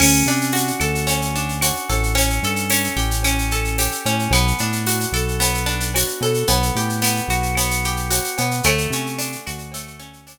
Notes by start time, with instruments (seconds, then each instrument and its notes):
0.00 synth bass 1 D2, acoustic guitar (steel) C#4, crash, cowbell, claves
0.14 shaker
0.26 synth bass 1 C3, acoustic guitar (steel) D4, shaker
0.41 shaker
0.52 acoustic guitar (steel) F#4, tambourine, shaker
0.67 shaker
0.80 synth bass 1 D2, acoustic guitar (steel) A4, claves, shaker
0.95 shaker
1.07 acoustic guitar (steel) C#4, cowbell, shaker
1.22 shaker
1.35 acoustic guitar (steel) D4, shaker
1.49 shaker
1.61 acoustic guitar (steel) F#4, tambourine, cowbell, claves, shaker
1.76 shaker
1.89 synth bass 1 A1, acoustic guitar (steel) A4, cowbell, shaker
2.03 shaker
2.15 acoustic guitar (steel) C#4, cowbell, shaker
2.30 shaker
2.43 synth bass 1 G2, acoustic guitar (steel) A4, shaker
2.56 shaker
2.70 acoustic guitar (steel) C#4, tambourine, claves, shaker
2.84 shaker
2.97 synth bass 1 A1, acoustic guitar (steel) G4, shaker
3.11 shaker
3.23 acoustic guitar (steel) C#4, cowbell, claves, shaker
3.38 shaker
3.51 acoustic guitar (steel) A4, shaker
3.65 shaker
3.78 acoustic guitar (steel) G4, tambourine, cowbell, shaker
3.92 shaker
4.05 synth bass 1 A2, acoustic guitar (steel) C#4, cowbell, shaker
4.19 shaker
4.31 synth bass 1 B1, acoustic guitar (steel) B3, cowbell, claves, shaker
4.47 shaker
4.58 synth bass 1 A2, acoustic guitar (steel) D4, shaker
4.72 shaker
4.86 acoustic guitar (steel) F#4, tambourine, shaker
5.00 shaker
5.12 synth bass 1 B1, acoustic guitar (steel) A4, claves, shaker
5.28 shaker
5.40 acoustic guitar (steel) B3, cowbell, shaker
5.54 shaker
5.66 acoustic guitar (steel) D4, shaker
5.80 shaker
5.94 acoustic guitar (steel) F#4, tambourine, cowbell, claves, shaker
6.08 shaker
6.21 synth bass 1 B2, acoustic guitar (steel) A4, cowbell, shaker
6.34 shaker
6.47 synth bass 1 B1, acoustic guitar (steel) B3, cowbell, shaker
6.63 shaker
6.75 synth bass 1 A2, acoustic guitar (steel) G4, shaker
6.89 shaker
7.02 acoustic guitar (steel) B3, tambourine, claves, shaker
7.16 shaker
7.28 synth bass 1 B1, acoustic guitar (steel) F#4, shaker
7.43 shaker
7.55 acoustic guitar (steel) B3, cowbell, claves, shaker
7.71 shaker
7.84 acoustic guitar (steel) G4, shaker
7.97 shaker
8.10 acoustic guitar (steel) F#4, tambourine, cowbell, shaker
8.24 shaker
8.37 synth bass 1 B2, acoustic guitar (steel) B3, cowbell, shaker
8.51 shaker
8.63 synth bass 1 D2, acoustic guitar (steel) A3, cowbell, claves, shaker
8.78 shaker
8.90 synth bass 1 C3, acoustic guitar (steel) C#4, shaker
9.06 shaker
9.18 acoustic guitar (steel) D4, tambourine, shaker
9.32 shaker
9.47 synth bass 1 D2, acoustic guitar (steel) F#4, claves, shaker
9.58 shaker
9.72 acoustic guitar (steel) A3, cowbell, shaker
9.87 shaker
9.99 acoustic guitar (steel) C#4, shaker
10.13 shaker
10.27 acoustic guitar (steel) D4, tambourine, cowbell, claves, shaker